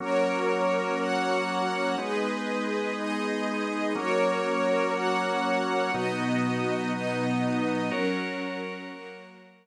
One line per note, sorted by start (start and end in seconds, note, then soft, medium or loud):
0.00 1.96 F#3 medium
0.00 1.96 A#3 medium
0.00 1.96 C#4 medium
0.00 0.98 F#4 medium
0.00 0.98 A#4 loud
0.00 0.98 C#5 medium
0.99 1.97 F#4 medium
0.99 1.97 C#5 medium
0.99 1.97 F#5 medium
1.98 3.94 G#3 medium
1.98 3.94 B3 medium
1.98 3.94 D#4 medium
1.98 2.96 G#4 medium
1.98 2.97 B4 medium
1.98 2.96 D#5 medium
2.97 3.95 D#4 medium
2.97 3.95 G#4 medium
2.97 3.95 D#5 loud
3.95 5.91 F#3 medium
3.95 5.91 A#3 medium
3.95 5.91 C#4 medium
3.95 4.93 F#4 medium
3.95 4.94 A#4 medium
3.95 4.93 C#5 loud
4.94 5.91 F#4 medium
4.94 5.91 C#5 medium
4.94 5.91 F#5 medium
5.93 7.90 B2 medium
5.93 7.90 F#3 medium
5.93 6.91 B3 medium
5.93 7.90 D#4 medium
5.93 6.91 F#4 medium
5.93 6.91 D#5 medium
6.93 7.91 B3 medium
6.93 7.91 D#4 medium
6.93 7.91 D#5 medium
7.91 8.89 F#3 medium
7.91 8.89 C#4 medium
7.91 9.67 F#4 medium
7.91 8.89 A#4 medium
7.91 9.67 A#4 medium
7.91 9.67 C#5 medium
8.90 9.67 F#3 medium
8.90 9.67 A#3 medium
8.90 9.67 A#4 medium